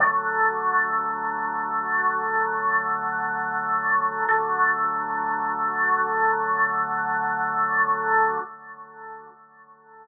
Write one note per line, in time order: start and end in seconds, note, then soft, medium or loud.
0.00 4.24 D3 medium
0.00 4.24 F#3 medium
0.00 4.24 A3 loud
4.29 8.38 D3 loud
4.29 8.38 F#3 medium
4.29 8.38 A3 loud